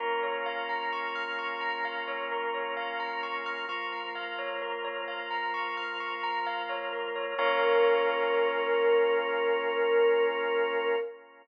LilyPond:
<<
  \new Staff \with { instrumentName = "Choir Aahs" } { \time 4/4 \key bes \dorian \tempo 4 = 65 r1 | r1 | bes'1 | }
  \new Staff \with { instrumentName = "Tubular Bells" } { \time 4/4 \key bes \dorian bes'16 des''16 f''16 bes''16 des'''16 f'''16 des'''16 bes''16 f''16 des''16 bes'16 des''16 f''16 bes''16 des'''16 f'''16 | des'''16 bes''16 f''16 des''16 bes'16 des''16 f''16 bes''16 des'''16 f'''16 des'''16 bes''16 f''16 des''16 bes'16 des''16 | <bes' des'' f''>1 | }
  \new Staff \with { instrumentName = "Synth Bass 2" } { \clef bass \time 4/4 \key bes \dorian bes,,1~ | bes,,1 | bes,,1 | }
  \new Staff \with { instrumentName = "Drawbar Organ" } { \time 4/4 \key bes \dorian <bes des' f'>1 | <f bes f'>1 | <bes des' f'>1 | }
>>